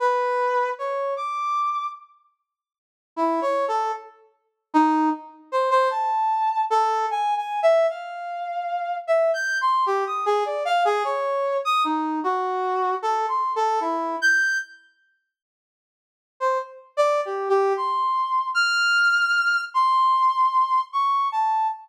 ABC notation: X:1
M:5/8
L:1/16
Q:1/4=76
K:none
V:1 name="Brass Section"
B4 _d2 =d'4 | z6 (3E2 _d2 A2 | z4 _E2 z2 c c | a4 A2 (3_a2 a2 e2 |
f6 (3e2 g'2 c'2 | G _e' _A d f A _d3 e' | _E2 _G4 (3A2 c'2 A2 | E2 g'2 z6 |
z3 c z2 (3d2 G2 G2 | c'4 f'6 | c'6 _d'2 a2 |]